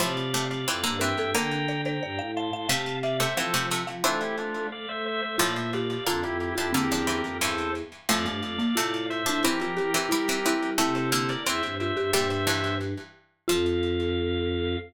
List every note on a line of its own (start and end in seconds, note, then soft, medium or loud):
0.00 0.32 A2 medium
0.00 0.65 C3 medium
0.00 0.32 F3 medium
0.00 0.94 C5 medium
0.00 0.44 D5 medium
0.00 0.44 F5 medium
0.34 0.63 C3 medium
0.34 0.63 A3 medium
0.50 0.97 D5 medium
0.50 0.97 F5 medium
0.67 0.83 F2 medium
0.67 0.84 E3 medium
0.67 0.84 C4 medium
0.84 1.14 G2 medium
0.84 1.00 D3 medium
0.84 1.00 A#3 medium
0.99 1.30 E3 medium
0.99 1.30 C4 medium
0.99 1.16 A#4 medium
0.99 1.31 E5 medium
0.99 1.31 G5 medium
1.18 1.33 G2 medium
1.18 1.35 A4 medium
1.35 2.60 D3 medium
1.35 1.99 D3 medium
1.35 2.60 A#3 loud
1.35 1.66 A#4 medium
1.35 1.81 G5 medium
1.35 1.81 A#5 loud
1.69 1.85 D5 medium
1.86 2.00 C5 medium
1.86 2.31 G5 medium
1.86 2.31 A#5 medium
2.02 2.18 G2 medium
2.02 2.17 D5 medium
2.19 2.50 A2 medium
2.19 2.34 F5 medium
2.36 2.51 F5 medium
2.36 2.68 A5 medium
2.36 2.68 C6 medium
2.53 2.67 A2 medium
2.53 2.67 F5 medium
2.69 3.17 C3 medium
2.69 3.26 C3 medium
2.69 3.17 A3 loud
2.69 3.01 F5 medium
2.69 2.96 F5 medium
2.69 2.96 A5 medium
3.03 3.17 D5 medium
3.03 3.35 E5 medium
3.03 3.17 F5 medium
3.20 3.34 C3 medium
3.20 3.34 A3 medium
3.20 3.36 C5 medium
3.20 3.36 E5 medium
3.37 3.53 E3 medium
3.37 3.53 F3 medium
3.37 3.53 C4 medium
3.37 3.67 A4 medium
3.37 3.67 C5 medium
3.37 3.79 F5 medium
3.54 3.70 C3 medium
3.54 3.83 F3 medium
3.54 3.70 A3 medium
3.71 4.04 C3 medium
3.71 4.04 A3 medium
3.87 4.03 F3 medium
3.87 4.02 F5 medium
4.04 4.78 E3 loud
4.04 4.67 A3 medium
4.04 4.78 C4 loud
4.04 4.21 D4 medium
4.04 4.21 F4 medium
4.04 4.89 C5 medium
4.22 4.36 E4 medium
4.22 4.36 G4 medium
4.38 4.67 D4 medium
4.38 4.67 F4 medium
4.72 4.86 A3 medium
4.72 4.88 D5 medium
4.72 4.88 F5 medium
4.89 5.22 A3 medium
4.89 5.05 C5 medium
4.89 5.05 E5 medium
5.06 5.21 C5 medium
5.06 5.21 E5 medium
5.22 5.37 A3 medium
5.22 5.36 C5 medium
5.22 5.36 E5 medium
5.38 5.98 A2 loud
5.38 5.95 A#2 medium
5.38 5.98 F3 loud
5.38 5.70 F4 medium
5.38 5.53 D5 medium
5.38 5.53 F5 medium
5.56 5.71 C5 medium
5.56 5.71 E5 medium
5.73 6.05 G4 medium
5.73 6.04 D5 medium
5.73 6.04 F5 medium
6.06 6.23 F2 medium
6.06 6.48 D3 medium
6.06 6.48 A#3 medium
6.06 6.22 D4 medium
6.06 6.22 F4 medium
6.06 6.49 F4 medium
6.24 6.52 F2 medium
6.24 6.38 E4 medium
6.24 6.38 G4 medium
6.40 6.54 E4 medium
6.40 6.54 G4 medium
6.55 6.73 F2 medium
6.55 6.74 F3 medium
6.55 6.74 D4 medium
6.55 6.72 E4 medium
6.55 6.71 F4 medium
6.55 6.72 G4 medium
6.73 7.22 E2 medium
6.73 6.89 D3 medium
6.73 6.89 A#3 medium
6.73 7.70 C4 medium
6.73 7.37 G4 medium
6.73 7.37 A#4 medium
6.92 7.07 F3 medium
6.92 7.07 D4 medium
7.07 7.39 E3 medium
7.07 7.39 C4 medium
7.25 7.39 F2 medium
7.41 7.82 E2 medium
7.41 7.70 G2 medium
7.41 7.70 E3 medium
7.41 7.72 A4 medium
7.41 7.72 C5 medium
8.09 8.26 F2 medium
8.09 8.74 A2 loud
8.09 8.74 F3 loud
8.09 8.25 A3 medium
8.09 9.06 D5 medium
8.09 9.06 F5 medium
8.25 8.40 G2 medium
8.25 8.53 A3 medium
8.43 8.57 F2 medium
8.58 8.74 A#3 medium
8.75 9.23 A2 medium
8.75 9.22 C3 medium
8.75 9.22 A3 medium
8.75 9.20 F4 medium
9.10 9.43 C5 medium
9.10 9.43 E5 medium
9.26 9.43 A2 medium
9.26 9.40 F3 medium
9.26 9.40 D4 medium
9.26 9.43 D4 medium
9.44 9.59 E3 medium
9.44 9.87 E3 loud
9.44 9.87 C4 loud
9.44 9.61 E4 medium
9.44 10.70 G4 medium
9.44 10.70 A#4 medium
9.61 9.77 F3 medium
9.61 9.77 F4 medium
9.77 9.94 E3 medium
9.77 9.90 G4 medium
9.94 10.09 E3 medium
9.94 10.09 C4 loud
9.94 10.10 G4 medium
10.09 10.54 G3 medium
10.09 10.27 G3 medium
10.09 10.38 E4 medium
10.09 10.27 E4 medium
10.29 10.44 E3 medium
10.29 10.44 C4 medium
10.46 10.79 E3 medium
10.46 10.79 C4 medium
10.46 10.77 E4 medium
10.62 10.78 G3 medium
10.78 11.10 C3 loud
10.78 11.34 C3 medium
10.78 11.10 A3 loud
10.78 11.75 E4 medium
10.78 10.95 A4 medium
10.78 10.95 C5 medium
10.96 11.10 A4 medium
10.96 11.10 C5 medium
11.12 11.41 D3 loud
11.12 11.41 A#3 loud
11.12 11.29 A4 medium
11.12 11.29 C5 medium
11.29 11.44 A#4 medium
11.29 11.44 D5 medium
11.46 11.61 E2 medium
11.46 12.03 E3 medium
11.46 12.03 C4 loud
11.46 11.75 C5 medium
11.46 11.75 E5 medium
11.63 11.91 G2 medium
11.80 11.96 F4 medium
11.80 12.11 C5 medium
11.80 12.11 E5 medium
11.97 12.11 G2 medium
11.97 12.11 G4 medium
12.13 12.94 G2 medium
12.13 12.44 A#2 loud
12.13 12.44 G3 loud
12.13 13.04 G4 medium
12.13 12.28 C5 medium
12.13 12.28 E5 loud
12.30 12.45 C5 medium
12.30 12.45 E5 medium
12.47 13.02 G2 medium
12.47 13.02 E3 medium
12.47 12.75 C5 medium
12.47 12.75 E5 medium
13.48 14.76 F2 loud
13.48 14.77 F3 loud
13.48 14.76 F4 loud
13.48 14.76 F5 loud